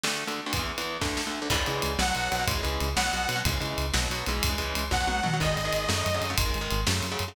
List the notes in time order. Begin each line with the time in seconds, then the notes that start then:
0.04 D2 D3 A3, snare
0.27 D2 D3 A3, ride
0.46 D2 D3 A3
0.53 E2 E3 B3, kick, ride
0.59 E2 E3 B3
0.78 E2 E3 B3, ride
1.01 D2 D3 A3, kick, snare
1.17 snare
1.27 D2 D3 A3
1.42 D2 D3 A3
1.50 C#2 C#3 E3 G#3, kick, crash
1.57 C#3 E3 G#3
1.66 C#2 C#3 E3 G#3, ride
1.82 C#2, ride
1.98 B1 B2 F#3 F#5, snare
2.08 B2 F#3
2.15 B1 B2 F#3, ride
2.32 B1 B2 F#3, ride
2.39 B2 F#3
2.47 C#2 C#3 E3 G#3, kick, ride
2.55 C#3 E3 G#3
2.63 C#2 C#3 E3 G#3, ride
2.80 C#2, ride
2.96 B1 B2 F#3 F#5, snare
3.06 B2 F#3
3.13 B1 B2 F#3, ride
3.29 B1 B2 F#3, ride
3.36 B2 F#3
3.45 C#2 C#3 E3 G#3, kick, ride
3.52 C#3 E3 G#3
3.60 C#2 C#3 E3 G#3, ride
3.78 C#2, ride
3.94 B1 B2 F#3, snare
4.02 B2 F#3
4.09 B1 B2 F#3, ride
4.26 B1 C#3 E3 G#3, ride
4.43 C#2, kick, ride
4.49 C#3 E3 G#3
4.58 C#2 C#3 E3 G#3, ride
4.75 C#2, ride
4.91 B1 B2 F#3 F#5, kick, snare
5.00 B2 F#3
5.07 B1 B2 F#3, high tom
5.23 B1 B2 F#3, mid tom
5.33 B2 F#3
5.40 G#1 D#3 G#3 D#5, kick, crash
5.47 D#3 G#3
5.56 G#1, ride
5.65 D#3 G#3
5.73 G#1, ride
5.89 F#2 C#3 F#3 A3, snare
6.06 F#2, ride
6.14 C#3 F#3 A3
6.21 F#2, ride
6.30 C#3 F#3 A3
6.38 G#1 D#3 G#3, kick, ride
6.46 D#3 G#3
6.54 G#1, ride
6.61 D#3 G#3
6.71 G#1, ride
6.87 F#2 C#3 F#3 A3, snare
7.03 F#2, ride
7.12 C#3 F#3 A3
7.19 F#2, ride
7.28 C#3 F#3 A3